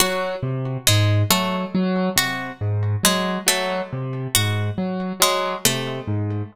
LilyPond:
<<
  \new Staff \with { instrumentName = "Acoustic Grand Piano" } { \clef bass \time 5/8 \tempo 4 = 69 ges8 c8 aes,8 ges8 ges8 | c8 aes,8 ges8 ges8 c8 | aes,8 ges8 ges8 c8 aes,8 | }
  \new Staff \with { instrumentName = "Harpsichord" } { \time 5/8 ges'8 r8 aes8 a8 r8 | ges'8 r8 aes8 a8 r8 | ges'8 r8 aes8 a8 r8 | }
>>